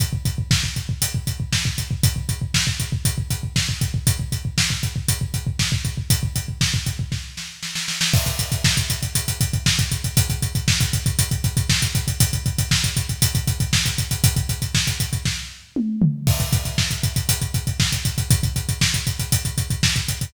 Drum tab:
CC |----------------|----------------|----------------|----------------|
HH |x-x---x-x-x---x-|x-x---x-x-x---x-|x-x---x-x-x---x-|x-x---x---------|
SD |----o-------o---|----o-------o---|----o-------o---|----o---o-o-oooo|
T2 |----------------|----------------|----------------|----------------|
FT |----------------|----------------|----------------|----------------|
BD |oooooooooooooooo|oooooooooooooooo|oooooooooooooooo|ooooooooo-------|

CC |x---------------|----------------|----------------|----------------|
HH |-xxx-xxxxxxx-xxx|xxxx-xxxxxxx-xxx|xxxx-xxxxxxx-xxx|xxxx-xxx--------|
SD |----o-------o---|----o-------o---|----o-------o---|----o---o-------|
T2 |----------------|----------------|----------------|------------o---|
FT |----------------|----------------|----------------|--------------o-|
BD |oooooooooooooooo|oooooooooooooooo|oooooooooooooooo|ooooooooo-------|

CC |x---------------|----------------|
HH |-xxx-xxxxxxx-xxx|xxxx-xxxxxxx-xxx|
SD |----o-------o---|----o-------o---|
T2 |----------------|----------------|
FT |----------------|----------------|
BD |oooooooooooooooo|oooooooooooooooo|